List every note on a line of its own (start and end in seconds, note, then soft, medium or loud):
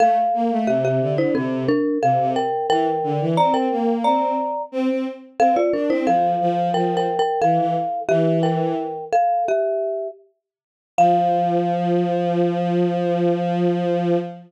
0.00 0.16 A3 medium
0.00 0.65 A4 medium
0.00 0.65 F5 medium
0.34 0.50 A#3 medium
0.51 0.67 A3 medium
0.67 1.00 C3 medium
0.67 0.83 G4 medium
0.67 0.83 E5 medium
0.85 1.15 G4 medium
0.85 1.15 E5 medium
1.01 1.33 D3 medium
1.18 1.34 E4 medium
1.18 1.34 C5 medium
1.35 1.64 C3 medium
1.35 1.67 C4 medium
1.35 1.67 A4 medium
1.69 1.98 D4 medium
1.69 1.98 A#4 medium
2.02 2.18 C3 medium
2.02 2.30 A4 medium
2.02 2.30 F5 medium
2.19 2.35 C3 medium
2.36 2.67 A#4 medium
2.36 2.67 G5 medium
2.70 2.86 E3 medium
2.70 3.25 A#4 medium
2.70 3.25 G5 medium
3.03 3.19 D3 medium
3.20 3.36 E3 medium
3.37 3.66 C4 medium
3.37 3.53 D5 medium
3.37 3.53 A#5 medium
3.54 3.96 A#4 medium
3.54 3.96 G5 medium
3.71 4.03 A#3 medium
4.04 4.34 C4 medium
4.04 4.62 D5 medium
4.04 4.62 A#5 medium
4.72 4.88 C4 medium
4.89 5.05 C4 medium
5.39 5.55 C4 medium
5.39 5.56 A4 medium
5.39 5.56 F5 medium
5.56 5.72 F4 medium
5.56 5.72 D5 medium
5.73 5.89 D4 medium
5.73 5.89 A#4 medium
5.90 6.06 C4 medium
5.90 6.06 E4 medium
5.90 6.06 C5 medium
6.07 6.34 F3 medium
6.07 6.73 A4 medium
6.07 6.73 F5 medium
6.40 6.69 F3 medium
6.74 7.06 F3 medium
6.74 6.96 A#4 medium
6.74 6.96 G5 medium
6.97 7.18 A#4 medium
6.97 7.18 G5 medium
7.19 7.40 A#4 medium
7.19 7.40 G5 medium
7.42 7.58 E3 medium
7.42 8.00 A4 medium
7.42 8.00 F5 medium
7.58 7.74 E3 medium
8.09 8.74 E3 medium
8.09 8.39 G4 medium
8.09 8.39 E5 medium
8.43 9.05 A#4 medium
8.43 9.05 G5 medium
9.13 9.44 A4 medium
9.13 9.44 F5 medium
9.48 10.08 G4 medium
9.48 10.08 E5 medium
10.98 14.17 F3 loud
10.98 14.17 F5 loud